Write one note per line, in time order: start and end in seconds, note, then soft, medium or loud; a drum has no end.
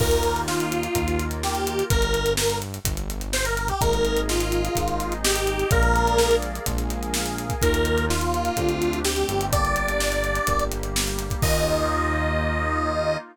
0.00 0.88 D#2 medium
0.00 0.86 A#3 medium
0.00 0.93 A#3 medium
0.00 0.86 D#4 medium
0.00 0.94 D#4 medium
0.00 0.86 F4 loud
0.00 0.93 F4 medium
0.00 0.41 A#4 loud
0.00 kick loud
0.00 crash loud
0.11 closed hi-hat medium
0.23 closed hi-hat medium
0.36 closed hi-hat medium
0.48 1.25 F4 medium
0.48 snare loud
0.60 closed hi-hat medium
0.72 closed hi-hat medium
0.83 closed hi-hat medium
0.94 1.83 D#2 medium
0.94 1.88 A#3 medium
0.94 1.81 A#3 loud
0.94 1.81 D#4 medium
0.94 1.88 F4 medium
0.94 1.81 F4 medium
0.94 1.88 A#4 medium
0.94 kick medium
0.94 closed hi-hat loud
1.08 closed hi-hat medium
1.19 closed hi-hat medium
1.31 closed hi-hat medium
1.43 1.84 G4 medium
1.43 snare loud
1.55 closed hi-hat medium
1.67 closed hi-hat medium
1.79 closed hi-hat medium
1.90 2.79 G1 loud
1.90 2.33 A#4 loud
1.90 kick loud
1.90 closed hi-hat loud
2.02 closed hi-hat medium
2.14 closed hi-hat medium
2.26 closed hi-hat medium
2.37 2.58 A#4 medium
2.37 snare loud
2.50 closed hi-hat medium
2.62 closed hi-hat medium
2.74 closed hi-hat medium
2.85 3.72 G1 medium
2.85 kick medium
2.85 closed hi-hat loud
2.97 closed hi-hat medium
3.10 closed hi-hat medium
3.21 closed hi-hat medium
3.33 3.45 C5 loud
3.33 snare loud
3.45 3.57 A#4 loud
3.45 closed hi-hat medium
3.57 3.68 A#4 medium
3.57 closed hi-hat medium
3.68 3.81 G4 medium
3.68 kick medium
3.68 closed hi-hat medium
3.80 4.69 G#1 medium
3.80 4.67 G#3 medium
3.80 4.67 A#3 loud
3.80 4.67 D#4 loud
3.80 4.75 G#4 medium
3.80 4.75 A#4 medium
3.80 4.21 A#4 loud
3.80 4.75 D#5 medium
3.80 kick loud
3.80 closed hi-hat loud
3.93 closed hi-hat medium
4.05 closed hi-hat medium
4.17 closed hi-hat medium
4.29 5.14 F4 medium
4.29 snare loud
4.40 closed hi-hat medium
4.52 closed hi-hat medium
4.65 closed hi-hat medium
4.75 5.64 G#1 medium
4.75 5.62 G#3 medium
4.75 5.62 A#3 medium
4.75 5.62 D#4 medium
4.75 5.71 D#4 medium
4.75 5.71 G#4 medium
4.75 5.71 D#5 medium
4.75 kick medium
4.75 closed hi-hat loud
4.88 closed hi-hat medium
5.00 closed hi-hat medium
5.12 closed hi-hat medium
5.24 5.70 G4 loud
5.24 snare loud
5.36 closed hi-hat medium
5.47 closed hi-hat medium
5.59 closed hi-hat medium
5.71 6.59 A#1 medium
5.71 6.57 G#3 medium
5.71 6.57 A#3 loud
5.71 6.57 D4 medium
5.71 6.57 F4 medium
5.71 6.67 G#4 medium
5.71 6.36 A#4 loud
5.71 6.67 A#4 medium
5.71 6.67 D5 medium
5.71 6.67 F5 medium
5.71 kick loud
5.71 closed hi-hat loud
5.83 closed hi-hat medium
5.96 closed hi-hat medium
6.07 closed hi-hat medium
6.18 snare loud
6.31 closed hi-hat medium
6.42 closed hi-hat medium
6.55 closed hi-hat medium
6.66 7.55 A#1 medium
6.66 7.52 G#3 medium
6.66 7.52 A#3 medium
6.66 7.52 D4 medium
6.66 7.52 F4 medium
6.66 7.62 G#4 medium
6.66 7.62 A#4 medium
6.66 7.62 F5 medium
6.66 7.62 G#5 medium
6.66 kick medium
6.66 closed hi-hat loud
6.78 closed hi-hat medium
6.90 closed hi-hat medium
7.03 closed hi-hat medium
7.14 snare loud
7.26 closed hi-hat medium
7.38 closed hi-hat medium
7.50 kick medium
7.50 closed hi-hat medium
7.62 8.50 D#2 medium
7.62 8.09 A#3 medium
7.62 8.05 A#3 medium
7.62 8.09 D#4 medium
7.62 8.05 D#4 loud
7.62 8.09 F4 medium
7.62 8.05 F4 loud
7.62 8.05 A#4 loud
7.62 kick medium
7.62 closed hi-hat loud
7.74 closed hi-hat medium
7.85 closed hi-hat medium
7.98 closed hi-hat medium
8.09 8.52 A#3 medium
8.09 8.57 A#3 medium
8.09 8.52 D#4 medium
8.09 8.99 F4 medium
8.09 8.52 F4 medium
8.09 8.57 F4 medium
8.09 8.57 A#4 medium
8.09 snare loud
8.21 closed hi-hat medium
8.34 closed hi-hat medium
8.45 closed hi-hat medium
8.56 9.24 D2 medium
8.56 9.00 A3 medium
8.56 9.04 A3 medium
8.56 9.00 C4 medium
8.56 9.04 C4 medium
8.56 9.00 D4 loud
8.56 9.05 D4 medium
8.56 9.00 G4 medium
8.56 9.04 G4 medium
8.56 kick medium
8.56 closed hi-hat medium
8.69 closed hi-hat medium
8.82 closed hi-hat medium
8.93 closed hi-hat medium
9.05 9.52 G3 medium
9.05 9.52 A3 medium
9.05 9.48 A3 medium
9.05 9.52 C4 medium
9.05 9.48 C4 medium
9.05 9.48 D4 medium
9.05 9.52 G4 medium
9.05 9.46 G4 medium
9.05 9.48 G4 medium
9.05 snare loud
9.16 closed hi-hat medium
9.28 10.40 G1 medium
9.28 closed hi-hat medium
9.41 closed hi-hat medium
9.52 10.38 A#3 loud
9.52 10.47 A#3 medium
9.52 10.38 D4 loud
9.52 10.48 D4 medium
9.52 10.38 G4 loud
9.52 10.47 G4 medium
9.52 10.64 D5 loud
9.52 kick loud
9.52 closed hi-hat loud
9.65 closed hi-hat medium
9.76 closed hi-hat medium
9.88 closed hi-hat medium
10.00 snare loud
10.12 closed hi-hat medium
10.24 closed hi-hat medium
10.35 closed hi-hat medium
10.47 11.35 G1 medium
10.47 11.42 G3 medium
10.47 11.42 A#3 medium
10.47 11.33 A#3 medium
10.47 11.33 D4 medium
10.47 11.42 G4 medium
10.47 11.33 G4 medium
10.47 kick medium
10.47 closed hi-hat loud
10.59 closed hi-hat medium
10.72 closed hi-hat medium
10.83 closed hi-hat medium
10.96 snare loud
11.07 closed hi-hat medium
11.19 closed hi-hat medium
11.30 kick medium
11.30 closed hi-hat medium
11.42 13.17 D#2 loud
11.42 13.16 A#3 loud
11.42 13.17 A#3 medium
11.42 13.16 D#4 medium
11.42 13.17 D#4 loud
11.42 13.16 F4 loud
11.42 13.17 F4 loud
11.42 13.17 D#5 loud
11.42 kick loud
11.42 crash loud